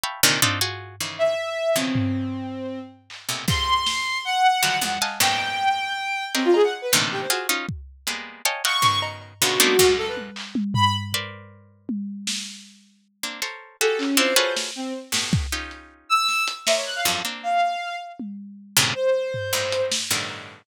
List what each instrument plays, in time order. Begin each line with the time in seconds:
0.04 harpsichord E5 F5 G5 A5 B5 C#6
0.23 harpsichord A#2 C3 D3 D#3
0.42 harpsichord C4 D4 D#4 F4, floor tom
0.61 harpsichord F4 F#4 G#4
1.00 harpsichord C#3 D#3 E3
1.18 violin E5
1.76 harpsichord B2 C#3 D#3 E3 F3, violin C4
1.95 floor tom
3.10 clap
3.29 harpsichord A2 A#2 B2 C3
3.48 harpsichord F2 G2 G#2, violin C6, kick
3.86 snare
4.25 violin F#5
4.63 harpsichord D3 D#3 F3 F#3 G3
4.81 harpsichord E2 F2 G2, violin F#5, high tom
5.01 harpsichord D#5 F5 F#5 G#5 A5, clap
5.20 harpsichord F#2 G#2 A#2 B2 C#3, violin G5, clap
5.39 cowbell
6.34 violin C4, harpsichord G4 G#4 A#4 C5 C#5 D#5, clap
6.45 violin F4
6.54 violin G#4, cowbell
6.64 violin F#5
6.82 violin B4
6.92 harpsichord A2 A#2 C3 D3 D#3 E3, clap
7.11 violin G4
7.21 violin C5
7.30 harpsichord F4 F#4 G#4, violin F#4, closed hi-hat
7.49 harpsichord C#4 D#4 F4
7.69 kick
8.07 harpsichord G3 G#3 A#3 B3, closed hi-hat
8.45 harpsichord C#5 D#5 F5 G5 G#5 A5, closed hi-hat
8.64 harpsichord D#5 F5 F#5 G5 A5, violin C#6, clap
8.82 harpsichord B2 C#3 D#3, floor tom
9.02 cowbell
9.21 cowbell
9.41 harpsichord A#2 B2 C#3 D3, violin F#4
9.60 harpsichord A3 A#3 B3 C4 D4 D#4, high tom
9.79 harpsichord F#2 G#2 A#2, kick
9.97 violin A4
10.07 violin B4
10.17 high tom
10.36 clap
10.55 high tom
10.74 violin B5, floor tom
11.13 harpsichord A#4 B4 C5 D5, floor tom
11.89 high tom
12.27 snare
13.23 harpsichord A#3 C4 D4
13.42 harpsichord A4 A#4 C5 C#5, closed hi-hat
13.81 harpsichord F#4 G4 G#4 A4, violin A4
13.98 violin C#4, clap
14.17 harpsichord C4 D4 E4 F4, violin C5
14.36 harpsichord F4 F#4 G#4 A4 B4 C#5
14.56 snare
14.76 violin C4
15.12 harpsichord G2 A2 B2, snare
15.33 kick
15.52 harpsichord C#4 D#4 F4 G4
15.71 closed hi-hat
16.09 violin E6
16.28 snare
16.48 closed hi-hat
16.66 harpsichord A#4 C5 C#5 D5 D#5, violin E5, snare
16.76 violin C#5
16.86 violin F#6
16.95 violin F5
17.05 harpsichord F2 F#2 G2
17.25 harpsichord A#3 C4 D4
17.43 violin F5
18.20 high tom
18.77 harpsichord G2 A2 A#2 C3 C#3
18.95 violin C5
19.34 floor tom
19.53 harpsichord G2 G#2 A2, cowbell
19.72 closed hi-hat
19.91 snare
20.11 harpsichord G2 A2 B2 C#3 D3 D#3
20.30 cowbell